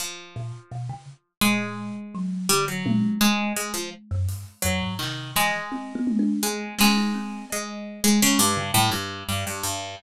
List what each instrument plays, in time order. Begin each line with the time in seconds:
0.00 harpsichord F3
0.36 kalimba A#2
0.71 kalimba B2
0.89 kalimba C#3
1.41 kalimba A#2, harpsichord G#3
2.14 kalimba F#3
2.49 kalimba D3, harpsichord G3
2.68 harpsichord F#3
2.86 kalimba A#2, high tom
3.21 harpsichord G#3
3.56 harpsichord G#3
3.74 harpsichord F3
4.11 kalimba F#2
4.29 kalimba G2, closed hi-hat
4.62 kalimba F2, harpsichord F#3
4.82 kalimba G#2
4.99 kalimba C3, harpsichord D#3, clap
5.36 kalimba E3, harpsichord G#3, clap
5.71 kalimba C4
5.95 kalimba B3
6.07 high tom
6.19 kalimba D4
6.43 harpsichord G#3
6.79 harpsichord G#3, kalimba C#4, snare
6.96 kalimba D#4
7.14 kalimba C4
7.50 harpsichord G#3, cowbell
8.04 kalimba G#3, harpsichord G#3
8.22 harpsichord C#3
8.39 harpsichord G2
8.57 kalimba C#3
8.74 harpsichord A2, kalimba G3
8.91 harpsichord G2
9.29 harpsichord G2
9.47 harpsichord G2
9.63 harpsichord G2